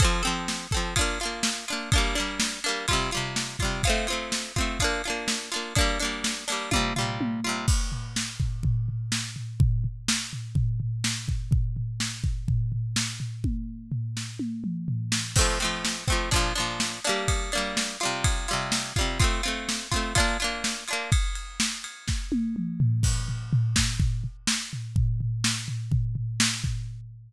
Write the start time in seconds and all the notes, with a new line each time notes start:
0.00 C4 A4, kick, ride
0.04 F3
0.23 C4 A4, ride
0.27 F3
0.48 snare
0.71 C4 A4, kick, ride
0.77 F3
0.96 D4 F4, kick, ride
1.01 A#3
1.20 D4 F4, ride
1.25 A#3
1.43 snare
1.68 D4 F4, ride
1.73 A#3
1.92 A#3 D4, kick, ride
1.98 G3
2.15 A#3 D4, ride
2.20 G3
2.40 snare
2.64 A#3 D4, ride
2.68 G3
2.88 G3 F4, kick, ride
2.93 C3
3.11 G3 F4, ride
3.17 C3
3.36 snare
3.59 G3 F4, kick, ride
3.64 C3
3.83 F4, kick, ride
3.87 A3 C4
4.07 C4 F4, ride
4.12 A3
4.32 snare
4.56 C4 F4, kick, ride
4.61 A3
4.79 D4 F4, kick, ride
4.84 A#3
5.04 D4 F4, ride
5.10 A#3
5.28 snare
5.52 D4 F4, ride
5.56 A#3
5.75 A#3 D4, kick, ride
5.81 G3
6.00 A#3 D4, ride
6.04 G3
6.24 snare
6.48 A#3 D4, ride
6.52 G3
6.71 G3 F4, kick, high tom
6.76 C3
6.96 G3 F4, floor tom
7.01 C3
7.21 high tom
7.44 G3 F4
7.49 C3
7.68 kick, crash
7.92 floor tom
8.16 snare
8.40 kick, floor tom
8.63 kick, floor tom
8.88 floor tom
9.12 snare
9.36 floor tom
9.60 kick, floor tom
9.84 floor tom
10.08 snare
10.33 floor tom
10.55 kick, floor tom
10.80 floor tom
11.04 snare
11.28 kick, floor tom
11.51 kick, floor tom
11.76 floor tom
12.00 snare
12.24 kick, floor tom
12.48 kick, floor tom
12.72 floor tom
12.96 snare
13.20 floor tom
13.44 kick, high tom
13.92 floor tom
14.17 snare
14.39 high tom
14.64 mid tom
14.88 floor tom
15.12 snare
15.36 A3 C4, kick, crash
15.41 F3
15.60 A3 C4, ride
15.64 F3
15.85 snare
16.08 A3 C4, kick, ride
16.12 F3
16.31 F3 D4, kick, ride
16.36 A#2
16.55 F3 D4, ride
16.60 A#2
16.80 snare
17.05 A#3 D4, ride
17.09 G3
17.28 kick, ride
17.52 A#3 D4, ride
17.57 G3
17.77 snare
18.00 G3 F4, ride
18.05 C3
18.24 kick, ride
18.48 G3 F4, ride
18.53 C3
18.72 snare
18.96 G3 F4, kick, ride
19.01 C3
19.20 C4 F4, kick, ride
19.24 A3
19.43 C4 F4, ride
19.48 A3
19.69 snare
19.91 C4 F4, kick, ride
19.96 A3
20.15 D4 F4, kick, ride
20.20 A#3
20.40 D4 F4, ride
20.44 A#3
20.64 snare
20.88 D4 F4, ride
20.93 A#3
21.12 kick, ride
21.35 ride
21.60 snare
21.84 ride
22.08 kick, snare
22.32 high tom
22.56 mid tom
22.80 floor tom
23.03 kick, crash
23.28 floor tom
23.53 floor tom
23.76 kick, snare
24.00 kick, floor tom
24.24 floor tom
24.47 snare
24.73 floor tom
24.96 kick, floor tom
25.21 floor tom
25.44 snare
25.68 floor tom
25.91 kick, floor tom
26.15 floor tom
26.40 snare
26.64 kick, floor tom